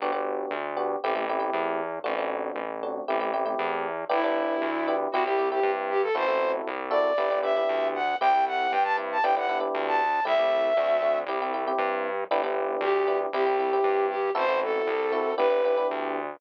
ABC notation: X:1
M:4/4
L:1/16
Q:1/4=117
K:G
V:1 name="Flute"
z16 | z16 | E8 F G2 G2 z G A | c3 z3 d4 e4 f2 |
g2 f2 g a z a g f2 z2 a3 | e8 z8 | z4 G3 z G6 G2 | c2 A6 B4 z4 |]
V:2 name="Electric Piano 1"
[B,DFG] [B,DFG]5 [B,DFG]2 [A,CEG] [A,CEG] [A,CEG] [A,CEG]5 | [A,CDF] [A,CDF]5 [A,CDF]2 [A,CEG] [A,CEG] [A,CEG] [A,CEG]5 | [B,DEG] [B,DEG]5 [B,DEG]2 [CEG] [CEG] [CEG] [CEG]5 | [CEFA] [CEFA]5 [CEFA]2 [B,DEG] [B,DEG] [B,DEG] [B,DEG]5 |
[CEG] [CEG]5 [CEG]2 [B,DEG] [B,DEG] [B,DEG] [B,DEG]5 | [A,CEG] [A,CEG]3 [A,CDF]2 [A,CDF]2 [CEG] [CEG] [CEG] [CEG]5 | [B,DEG] [B,DEG]5 [B,DEG]2 [CEG] [CEG] [CEG] [CEG]5 | [CEFA] [CEFA]5 [CEFA]2 [B,DEG] [B,DEG] [B,DEG] [B,DEG]5 |]
V:3 name="Synth Bass 1" clef=bass
G,,,4 D,,4 A,,,4 E,,4 | A,,,4 A,,,4 A,,,4 E,,4 | G,,,4 D,,4 C,,4 G,,4 | A,,,4 C,,4 G,,,4 D,,4 |
C,,4 G,,4 G,,,4 D,,4 | C,,4 D,,4 C,,4 G,,4 | G,,,4 D,,4 C,,4 G,,4 | A,,,4 C,,4 G,,,4 D,,4 |]